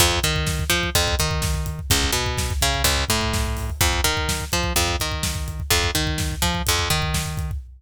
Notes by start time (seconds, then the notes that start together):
0.00 F2, kick, closed hi-hat
0.11 kick
0.23 D#3, kick, closed hi-hat
0.36 kick
0.47 kick, snare
0.59 kick
0.70 F3, kick, closed hi-hat
0.83 kick
0.95 F2, kick, closed hi-hat
1.08 kick
1.19 D#3, kick, closed hi-hat
1.31 kick
1.42 kick, snare
1.54 kick
1.66 kick, closed hi-hat
1.79 kick
1.90 C#2, kick, closed hi-hat
2.03 kick
2.12 B2, kick, closed hi-hat
2.26 kick
2.38 kick, snare
2.50 kick
2.62 C#3, kick, closed hi-hat
2.74 kick
2.84 C#2, kick, closed hi-hat
2.98 kick
3.09 A2, kick, closed hi-hat
3.21 kick
3.34 kick, snare
3.45 kick
3.57 kick, open hi-hat
3.70 kick
3.81 F2, kick, closed hi-hat
3.93 kick
4.04 D#3, kick, closed hi-hat
4.17 kick
4.29 kick, snare
4.40 kick
4.52 F3, kick, closed hi-hat
4.63 kick
4.76 F2, kick, closed hi-hat
4.88 kick
5.00 D#3, kick, closed hi-hat
5.12 kick
5.23 kick, snare
5.35 kick
5.48 kick, closed hi-hat
5.60 kick
5.70 F2, kick, closed hi-hat
5.84 kick
5.95 D#3, kick, closed hi-hat
6.07 kick
6.18 kick, snare
6.31 kick
6.42 F3, kick, closed hi-hat
6.55 kick
6.67 F2, kick, closed hi-hat
6.79 kick
6.90 D#3, kick, closed hi-hat
7.02 kick
7.14 kick, snare
7.26 kick
7.37 kick, closed hi-hat
7.51 kick